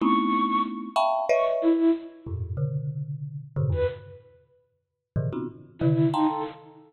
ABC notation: X:1
M:2/4
L:1/16
Q:1/4=93
K:none
V:1 name="Marimba"
[A,B,C_D_E=E]6 [efgab_d']2 | [B_d_e=e]3 z3 [F,,G,,A,,_B,,]2 | [B,,_D,=D,]6 [G,,A,,_B,,C,_D,=D,] [E,,_G,,=G,,] | z8 |
[_A,,=A,,B,,_D,_E,=E,] [B,C_D_EF_G] z2 [C,=D,_E,]2 [f=ga_bc']2 | z8 |]
V:2 name="Ocarina"
_d'4 z4 | _d' z E2 z4 | z7 B | z8 |
z4 E2 _E A | z8 |]